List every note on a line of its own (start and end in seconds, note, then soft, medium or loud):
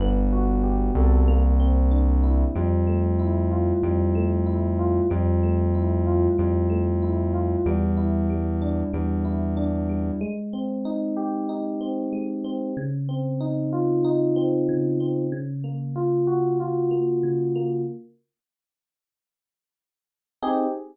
0.00 0.91 G1 loud
0.00 1.22 B3 medium
0.32 1.23 F#4 medium
0.63 1.24 G4 medium
0.95 2.44 C2 loud
0.95 1.27 A4 medium
1.28 2.49 A#3 loud
1.60 2.51 C4 medium
1.91 2.52 D4 medium
2.24 2.54 E4 medium
2.55 3.73 F2 medium
2.55 3.83 G3 medium
2.87 4.15 A3 medium
3.19 4.46 E4 medium
3.51 4.79 F4 medium
3.83 5.01 F2 medium
3.83 5.05 G3 medium
4.15 5.06 A3 medium
4.47 5.07 E4 medium
4.79 5.09 F4 medium
5.10 6.28 F2 loud
5.10 6.38 G3 medium
5.43 6.69 A3 medium
5.75 7.02 E4 medium
6.06 7.33 F4 medium
6.38 7.56 F2 medium
6.38 7.60 G3 medium
6.70 7.61 A3 medium
7.03 7.63 E4 medium
7.34 7.64 F4 medium
7.66 8.83 E2 medium
7.66 8.29 G3 loud
7.97 9.24 E4 medium
8.30 8.93 G3 medium
8.62 9.56 D4 medium
8.93 10.11 E2 medium
8.93 9.89 G3 medium
9.25 10.16 E4 medium
9.57 10.18 D4 medium
9.89 10.20 G3 medium
10.21 12.12 G#3 loud
10.53 11.80 C4 medium
10.85 11.49 D#4 medium
11.17 12.68 G4 medium
11.49 12.70 D#4 medium
11.81 12.44 C4 medium
12.13 12.73 G#3 medium
12.44 12.75 C4 medium
12.77 14.68 C#3 loud
13.09 14.36 C4 medium
13.41 14.04 D#4 medium
13.73 15.24 F4 medium
14.05 15.26 D#4 medium
14.36 15.00 C4 medium
14.69 15.29 C#3 medium
15.00 15.31 C4 medium
15.32 17.23 C#3 loud
15.64 16.91 A#3 medium
15.96 16.59 F4 medium
16.27 17.79 F#4 medium
16.60 17.81 F4 medium
16.91 17.55 A#3 medium
17.23 17.84 C#3 medium
17.56 17.86 A#3 medium
20.43 20.65 C4 medium
20.43 20.65 D#4 medium
20.43 20.65 G4 loud
20.43 20.65 G#4 loud